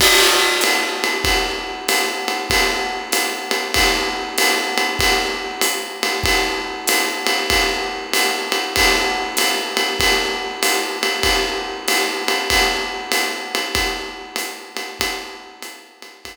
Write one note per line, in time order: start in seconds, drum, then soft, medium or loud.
0.00 kick soft
0.00 crash loud
0.00 ride medium
0.61 hi-hat pedal medium
0.61 ride medium
1.04 ride medium
1.24 kick medium
1.24 ride medium
1.88 hi-hat pedal medium
1.88 ride medium
2.28 ride medium
2.50 kick soft
2.50 ride medium
3.12 hi-hat pedal medium
3.12 ride medium
3.51 ride medium
3.74 kick medium
3.74 ride medium
4.38 hi-hat pedal medium
4.38 ride medium
4.78 ride medium
4.99 kick soft
4.99 ride medium
5.61 hi-hat pedal medium
5.61 ride medium
6.03 ride medium
6.24 kick medium
6.24 ride medium
6.88 hi-hat pedal medium
6.88 ride medium
7.27 ride medium
7.50 kick soft
7.50 ride medium
8.13 hi-hat pedal medium
8.13 ride medium
8.52 ride medium
8.76 kick medium
8.76 ride loud
9.37 hi-hat pedal medium
9.37 ride medium
9.77 ride medium
10.00 kick soft
10.00 ride medium
10.62 hi-hat pedal medium
10.62 ride medium
11.03 ride medium
11.23 kick soft
11.23 ride medium
11.88 hi-hat pedal medium
11.88 ride medium
12.28 ride medium
12.50 kick medium
12.50 ride medium
13.12 hi-hat pedal medium
13.12 ride medium
13.55 ride medium
13.75 kick medium
13.75 ride medium
14.36 hi-hat pedal medium
14.36 ride medium
14.77 ride medium
15.00 kick soft
15.00 ride loud
15.62 hi-hat pedal medium
15.62 ride medium
16.02 ride medium
16.25 kick soft
16.25 ride medium